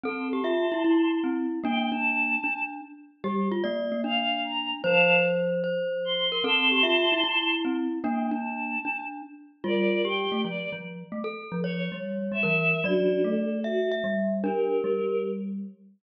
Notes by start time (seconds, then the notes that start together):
0.04 C4 A4 A5 C6
0.33 G4
0.44 F4 E5
0.72 E4
0.84 E4
1.24 C4
1.64 A#3 D4 G5
1.92 D4 A5
2.44 D4
3.23 G3 G4
3.52 F4
3.64 A#3 D5
3.92 A#3
4.04 D4 F5
4.44 A#5
4.84 F3 C5 F5 A5
5.64 C5
6.05 C6
6.32 A#4
6.44 C4 A4 A5 C6
6.72 G4
6.83 F4 E5
7.12 E4
7.24 E4
7.65 C4
8.04 A#3 D4 G5
8.31 D4 A5
8.85 D4
9.64 G3 F4 A#4 D5
10.05 G4 G5
10.32 A3
10.44 F3 D5
10.72 F3
11.12 A3
11.24 A4
11.52 F3
11.64 C#5
11.92 G3
12.32 G3 E5
12.43 E3 A#4
12.84 F#3 D4 F#4 D5
13.24 A3 A4
13.64 F#4 E5
13.91 E5
14.04 G3
14.44 D4 G4 A#4
14.84 G3